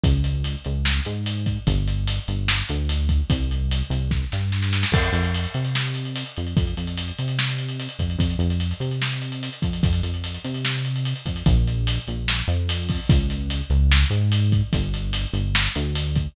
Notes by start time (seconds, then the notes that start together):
0.03 C#2, kick, closed hi-hat
0.24 closed hi-hat
0.44 closed hi-hat
0.65 C#2, closed hi-hat
0.85 snare
1.05 G#2, closed hi-hat
1.26 closed hi-hat
1.46 kick, closed hi-hat
1.67 G1, kick, closed hi-hat
1.88 closed hi-hat
2.07 closed hi-hat
2.28 G1, closed hi-hat
2.48 snare
2.69 D2, closed hi-hat
2.89 closed hi-hat
3.09 kick, closed hi-hat
3.30 C2, kick, closed hi-hat
3.51 closed hi-hat
3.71 closed hi-hat
3.90 C2, closed hi-hat
4.11 kick, snare
4.32 G2, snare
4.52 snare
4.62 snare
4.73 snare
4.83 snare
4.92 F2, kick, crash
5.04 closed hi-hat
5.12 F2, closed hi-hat
5.23 closed hi-hat
5.34 closed hi-hat
5.44 closed hi-hat
5.54 C3, closed hi-hat
5.65 closed hi-hat
5.75 snare
5.85 closed hi-hat
5.95 closed hi-hat
6.05 closed hi-hat
6.16 closed hi-hat
6.26 closed hi-hat
6.37 F2, closed hi-hat
6.47 closed hi-hat
6.57 F2, kick, closed hi-hat
6.67 closed hi-hat
6.77 F2, closed hi-hat
6.87 closed hi-hat
6.97 closed hi-hat
7.08 closed hi-hat
7.18 C3, closed hi-hat
7.28 closed hi-hat
7.39 snare
7.49 closed hi-hat
7.59 closed hi-hat
7.69 closed hi-hat
7.80 closed hi-hat
7.89 closed hi-hat
7.99 F2, kick, closed hi-hat
8.10 closed hi-hat
8.18 F2, kick, closed hi-hat
8.30 closed hi-hat
8.39 F2, closed hi-hat
8.50 closed hi-hat
8.60 closed hi-hat
8.71 closed hi-hat
8.80 C3, closed hi-hat
8.91 closed hi-hat
9.02 snare
9.12 closed hi-hat
9.22 closed hi-hat
9.32 closed hi-hat
9.43 closed hi-hat
9.53 closed hi-hat
9.62 F2, kick, closed hi-hat
9.73 closed hi-hat
9.83 F2, kick, closed hi-hat
9.93 closed hi-hat
10.03 F2, closed hi-hat
10.14 closed hi-hat
10.24 closed hi-hat
10.34 closed hi-hat
10.44 C3, closed hi-hat
10.54 closed hi-hat
10.65 snare
10.75 closed hi-hat
10.85 closed hi-hat
10.96 closed hi-hat
11.05 closed hi-hat
11.16 closed hi-hat
11.26 F2, kick, closed hi-hat
11.36 closed hi-hat
11.46 A#1, kick, closed hi-hat
11.67 closed hi-hat
11.87 closed hi-hat
12.08 A#1, closed hi-hat
12.28 snare
12.48 F2, closed hi-hat
12.69 closed hi-hat
12.89 kick, open hi-hat
13.09 C#2, kick, closed hi-hat
13.30 closed hi-hat
13.50 closed hi-hat
13.70 C#2, closed hi-hat
13.92 snare
14.10 G#2, closed hi-hat
14.32 closed hi-hat
14.52 kick, closed hi-hat
14.73 G1, kick, closed hi-hat
14.94 closed hi-hat
15.13 closed hi-hat
15.33 G1, closed hi-hat
15.55 snare
15.75 D2, closed hi-hat
15.95 closed hi-hat
16.16 kick, closed hi-hat